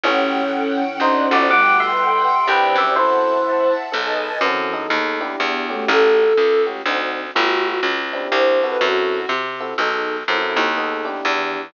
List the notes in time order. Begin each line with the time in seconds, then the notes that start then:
0.03 A1 E3 A3 C#4 F#4 G4 A4 C#5 F#5 G5
0.33 C#4
0.81 C#4
1.00 D2 C4 D4 D#4 F#4 C5 D5 D#5 F#5
1.31 G1 F#4 D5
1.50 G3 A3 B3 F#4 G4 A4 B4 F#5 G5 D6
1.80 E5 C6
2.47 C2 C4 D4 E4 G4 B4 C5 D5 E5 G5
2.75 F#2 G4 E5
2.96 E3 C4 E4 F#4 A4 C5 E5 F#5 A5
3.92 B1 B3 D#4 G#4 A4 B4 D#5 G#5 A5
4.41 F#2 E3 C4 E4 F#4 A4
4.73 E3 B3 D#4 G#4 A4
4.90 D#2
5.21 B3 D4 E4 G4
5.40 E2 B3
5.69 A3 C#4 F#4 G4
5.88 A1 A4
6.37 C#2
6.67 A3 C#4 F#4 G4
6.85 D2 C4 D4 D#4 F#4
7.35 G1 A3 B3 F#4 G4
7.64 F#4
7.83 C#2
8.13 C4 D4 E4 G4
8.32 C2 C5
8.62 C4 E4 F#4 A4 B4
8.81 F#2 F#4
9.29 C3
9.60 C4 E4 F#4 A4
9.78 B1 B3 D#4 G#4 A4
10.28 F#2 C4 E4 F#4 A4
10.56 D#2
10.77 B3 D#4 G#4 A4
11.05 B3 D4 E4 G4
11.25 E2 E3
11.56 E3